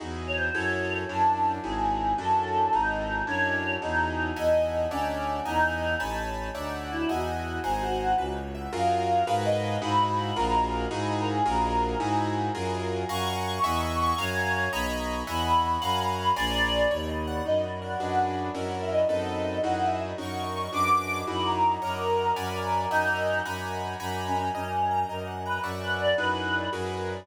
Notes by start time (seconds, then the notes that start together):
0.00 E2 D#4 E4 F#4 G#4
0.27 C#5
0.36 C5
0.54 F#2 E4 F#4 G#4 A4 C#5
1.09 F#2 C#4 D4 E4 F#4 A5
1.64 G#1 D#4 E4 F#4 G#4
2.18 F#2 C#4 D4 E4 F#4 A4
2.73 G#1 D#4 E4 F#4 G#4
3.27 F#2 C#4 D4 E4 F#4 C#5
3.82 E2 D#4 E4 F#4 G#4
4.36 E2 D#5 E5 F#5 G#5
4.91 D2 C#4 C#5 D5 E5 F#5
5.45 E2 D#4 D#5 E5 F#5 G#5
6.00 A1 C#5 G#5 A5 B5
6.55 D2 C#5 D5 E5 F#5
6.82 F#4
6.91 E4
7.09 E2 F#4 D#5 E5 F#5 G#5
7.63 G#1 G#4 C5 F#5 G#5 A#5
7.81 F#4
8.18 C#2 B4
8.36 C#5
8.55 E5
8.73 F#2 F4 F#4 G#4 A#4 F5
9.27 G#2 F#4 G#4 A#4 B4
9.45 D#5
9.82 G#2 D#4 E4 F#4 G#4 B5
10.36 A#1 F4 F#4 G#4 A#4
10.91 G#2 D#4 E4 F#4 G#4
11.19 A#4
11.28 G#4
11.45 A#1 F4 F#4 G#4 A#4
11.99 G#2 D#4 E4 F#4 G#4 G#5
12.55 F#2 F4 F#4 G#4 A#4
13.09 F#2 F5 F#5 G#5 A#5 C#6
13.63 E2 D#5 E5 F#5 G#5
14.00 C#6
14.18 F#2 C#5 F5 F#5 G#5 A#5
14.73 B1 D#5 A#5 B5 C#6
15.27 E2 D#5 E5 F#5 G#5 B5
15.82 F#2 F5 F#5 G#5 A#5
16.17 B5
16.36 A#1 D5 G#5 A#5 C6
16.91 D#2 C#5
17.09 D#5
17.27 F#5
17.45 F#2 D#4 D#5
17.64 F#4
17.82 A#4 F#5
18.00 F#2 D4 F#4 G#4 B4
18.28 F#5
18.55 F#2 C#4 E4 F#4 A#4
18.82 E5
18.91 D#5
19.09 F#2 C4 D#4 A4 B4 D#5
19.63 F#2 D#4 E4 F#4 G#4 F#5
19.82 E5
19.91 E5
20.18 F#2 C#4 D#4 F#4 A#4 C#6
20.73 F#2 D4 F#4 G#4 B4 D6
21.27 F#2 D#4 E4 F#4 G#4 B5
21.46 A#5
21.82 F#2 A#4 C#5 D#5 F#5 A#5
22.36 F#2 D5 F#5 G#5 B5
22.55 A#4
22.91 F#2 D#4 D#5 E5 F#5 G#5
23.45 F#2 F#5 G#5 A#5 B5
24.00 F#2 F#5 G#5 A#5 B5
24.27 C#4
24.36 C#4
24.55 F#2 C#4 D#5
24.73 F#5
24.91 A#5
25.09 F#2 A#4 D#5
25.27 F#5
25.45 B4 A#5
25.63 F#2 D5 E5 F#5 C#6
25.82 B4
26.00 D5
26.18 F#2 D#4 E4 F#4 G#4 B4
26.73 F#2 F#4 G#4 A#4 B4